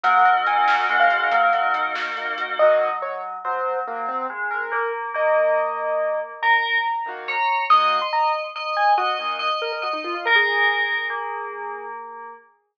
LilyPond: <<
  \new Staff \with { instrumentName = "Acoustic Grand Piano" } { \time 12/8 \key ees \dorian \tempo 4. = 94 ges''4 aes''4 ges''16 f''4.~ f''16 r2 | ees''4 des''8 r8 c''4 bes8 c'8 r8 bes'8 bes'8 r8 | ees''2. bes''2 bes''4 | ees'''8. c'''16 bes''8 r4 aes''8 ges'8 r4 bes'16 bes'16 ges'16 ees'16 f'16 f'16 |
bes'16 aes'2.~ aes'8. r2 | }
  \new Staff \with { instrumentName = "Tubular Bells" } { \time 12/8 \key ees \dorian ges4 ges4 aes4 ges4. r4. | ges2 ges4 ges4 aes4 bes4 | bes2. bes'4 r4 des''4 | ees''2 ees''4 ees''4 ees''4 ees''4 |
bes'2 bes2. r4 | }
  \new Staff \with { instrumentName = "Acoustic Grand Piano" } { \time 12/8 \key ees \dorian bes8 ges'8 ees'8 ges'8 bes8 ges'8 bes8 ges'8 ees'8 ges'8 bes8 ges'8 | <ees bes ges'>1.~ | <ees bes ges'>1~ <ees bes ges'>8 <ees bes ges'>4. | <ees bes ges'>2.~ <ees bes ges'>8 <ees bes ges'>2~ <ees bes ges'>8~ |
<ees bes ges'>1. | }
  \new Staff \with { instrumentName = "Tubular Bells" } { \time 12/8 \key ees \dorian bes'8 ees''8 ges''8 bes'8 ees''8 ges''8 bes'8 ees''8 ges''8 bes'8 ees''8 ges''8 | r1. | r1. | r1. |
r1. | }
  \new Staff \with { instrumentName = "Pad 5 (bowed)" } { \time 12/8 \key ees \dorian <bes ees' ges'>2. <bes ees' ges'>2. | r1. | r1. | r1. |
r1. | }
  \new DrumStaff \with { instrumentName = "Drums" } \drummode { \time 12/8 <hh bd>8 hh8 hh8 sn8 hh8 hh8 <hh bd>8 hh8 hh8 sn8 hh8 hh8 | r4. r4. r4. r4. | r4. r4. r4. r4. | r4. r4. r4. r4. |
r4. r4. r4. r4. | }
>>